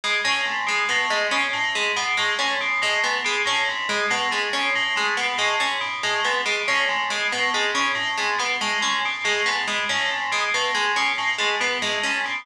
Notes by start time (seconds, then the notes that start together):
0.04 B2 G#3
0.24 A2 C#4
0.45 G#2
0.67 B2 G#3
0.89 A2 B3
1.10 G#2 G#3
1.31 B2 C#4
1.53 A2
1.75 G#2 G#3
1.96 B2 B3
2.17 A2 G#3
2.39 G#2 C#4
2.61 B2
2.82 A2 G#3
3.04 G#2 B3
3.24 B2 G#3
3.46 A2 C#4
3.69 G#2
3.89 B2 G#3
4.10 A2 B3
4.31 G#2 G#3
4.53 B2 C#4
4.75 A2
4.96 G#2 G#3
5.17 B2 B3
5.38 A2 G#3
5.60 G#2 C#4
5.81 B2
6.03 A2 G#3
6.24 G#2 B3
6.45 B2 G#3
6.68 A2 C#4
6.88 G#2
7.10 B2 G#3
7.32 A2 B3
7.54 G#2 G#3
7.74 B2 C#4
7.95 A2
8.17 G#2 G#3
8.38 B2 B3
8.61 A2 G#3
8.81 G#2 C#4
9.05 B2
9.24 A2 G#3
9.46 G#2 B3
9.67 B2 G#3
9.89 A2 C#4
10.10 G#2
10.32 B2 G#3
10.54 A2 B3
10.74 G#2 G#3
10.96 B2 C#4
11.18 A2
11.38 G#2 G#3
11.60 B2 B3
11.82 A2 G#3
12.03 G#2 C#4
12.26 B2